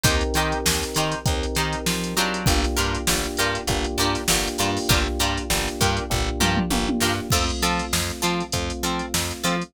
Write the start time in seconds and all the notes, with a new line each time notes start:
0.04 D#2 C4 D#4 G4 A#4 C5, kick, closed hi-hat
0.21 closed hi-hat
0.34 D#3 D#4 G4 A#4 C5, closed hi-hat
0.52 closed hi-hat
0.66 D#2, snare
0.83 snare, closed hi-hat
0.95 D#3 D#4 G4 A#4 C5, closed hi-hat
1.12 closed hi-hat
1.26 D#2 C4 D#4 G4 A#4, kick, closed hi-hat
1.43 closed hi-hat
1.55 D#3 D#4 G4 A#4 C5, closed hi-hat
1.73 closed hi-hat
1.86 F3, snare
2.04 closed hi-hat
2.17 F#3 D4 F4 G4 A#4, closed hi-hat
2.34 closed hi-hat
2.46 G1 A#3 D4 F4 G4, kick, closed hi-hat
2.64 snare, closed hi-hat
2.77 G2 D4 F4 G4 A#4, closed hi-hat
2.95 closed hi-hat
3.07 G1 A#3 D4 F4 G4, snare
3.24 closed hi-hat
3.37 G2 D4 F4 G4 A#4, closed hi-hat
3.55 closed hi-hat
3.67 G1 A#3 D4 F4 G4, kick, closed hi-hat
3.84 closed hi-hat
3.98 G2 D4 F4 G4 A#4, closed hi-hat
4.15 snare, closed hi-hat
4.28 G1 A#3 D4 F4 G4, snare
4.48 closed hi-hat
4.58 G2 A#3 D4 F4 G4 A#4, closed hi-hat
4.77 snare, open hi-hat
4.89 G1 D4 F4 G4 A#4, kick, closed hi-hat
5.08 snare
5.19 G2 D4 F4 G4 A#4, closed hi-hat
5.38 closed hi-hat
5.50 G1 A#3 D4 F4 G4, snare
5.68 closed hi-hat
5.81 G2 D4 F4 G4 A#4, kick, closed hi-hat
5.97 closed hi-hat
6.10 G1 A#3 D4 F4 G4, kick, floor tom
6.40 G2 D4 F4 G4 A#4, mid tom
6.57 mid tom
6.70 G1 A#3 D4 F4 G4, high tom
6.89 high tom
7.01 G2 D4 F4 G4 A#4, snare
7.30 F2 A3 C4 F4 A4, kick, crash
7.50 closed hi-hat
7.62 F3 C4 F4 A4, closed hi-hat
7.79 closed hi-hat
7.93 F2, snare
8.10 closed hi-hat
8.22 F3 C4 F4 A4, closed hi-hat
8.40 closed hi-hat
8.52 F2 A3 C4 F4, kick, closed hi-hat
8.70 closed hi-hat
8.83 F3 C4 F4 A4, closed hi-hat
8.99 closed hi-hat
9.14 F2, snare
9.31 closed hi-hat
9.44 F3 C4 F4 A4, closed hi-hat
9.62 closed hi-hat